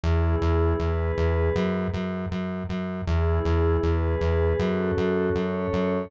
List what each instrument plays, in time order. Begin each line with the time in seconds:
0.03 synth bass 1 E2, pad 5 (bowed) B3 E4 G#4
0.41 synth bass 1 E2
0.80 synth bass 1 E2, pad 5 (bowed) B3 G#4 B4
1.17 synth bass 1 E2
1.55 synth bass 1 F#2
1.94 synth bass 1 F#2
2.31 synth bass 1 F#2
2.69 synth bass 1 F#2
3.07 synth bass 1 E2, pad 5 (bowed) B3 E4 G#4
3.45 synth bass 1 E2
3.83 synth bass 1 E2, pad 5 (bowed) B3 G#4 B4
4.21 synth bass 1 E2
4.59 synth bass 1 F#2, pad 5 (bowed) C#4 F#4 A4
4.97 synth bass 1 F#2
5.34 synth bass 1 F#2, pad 5 (bowed) C#4 A4 C#5
5.73 synth bass 1 F#2